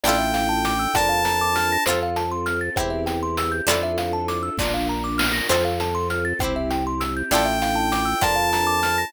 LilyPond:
<<
  \new Staff \with { instrumentName = "Lead 2 (sawtooth)" } { \time 6/8 \key f \major \tempo 4. = 66 g''4. a''4. | r2. | r2. | r2. |
g''4. a''4. | }
  \new Staff \with { instrumentName = "Harpsichord" } { \time 6/8 \key f \major <d' e' f' a'>4. <d' f' bes'>4. | <c' f' a'>4. <c' e' g'>4. | <d' e' f' a'>4. <d' f' bes'>4. | <c' f' a'>4. <c' e' g'>4. |
<d' e' f' a'>4. <d' f' bes'>4. | }
  \new Staff \with { instrumentName = "Kalimba" } { \time 6/8 \key f \major d''16 e''16 f''16 a''16 d'''16 e'''16 d''16 f''16 bes''16 d'''16 f'''16 bes'''16 | c''16 f''16 a''16 c'''16 f'''16 a'''16 c''16 e''16 g''16 c'''16 e'''16 g'''16 | d''16 e''16 f''16 a''16 d'''16 e'''16 d''16 f''16 bes''16 d'''16 f'''16 bes'''16 | c''16 f''16 a''16 c'''16 f'''16 a'''16 c''16 e''16 g''16 c'''16 e'''16 g'''16 |
d''16 e''16 f''16 a''16 d'''16 e'''16 d''16 f''16 bes''16 d'''16 f'''16 bes'''16 | }
  \new Staff \with { instrumentName = "String Ensemble 1" } { \time 6/8 \key f \major <d' e' f' a'>4. <d' f' bes'>4. | <c' f' a'>4. <c' e' g'>4. | <d' e' f' a'>4. <d' f' bes'>4. | <c' f' a'>4. <c' e' g'>4. |
<d' e' f' a'>4. <d' f' bes'>4. | }
  \new Staff \with { instrumentName = "Drawbar Organ" } { \clef bass \time 6/8 \key f \major a,,4. f,4. | f,4. e,4. | f,4. bes,,4. | f,4. c,4. |
a,,4. f,4. | }
  \new DrumStaff \with { instrumentName = "Drums" } \drummode { \time 6/8 hh8 hh8 hh8 <bd ss>8 hh8 hh8 | hh8 hh8 hh8 <bd ss>8 hh8 hh8 | hh8 hh8 hh8 <bd sn>4 sn8 | hh8 hh8 hh8 <bd ss>8 hh8 hh8 |
hh8 hh8 hh8 <bd ss>8 hh8 hh8 | }
>>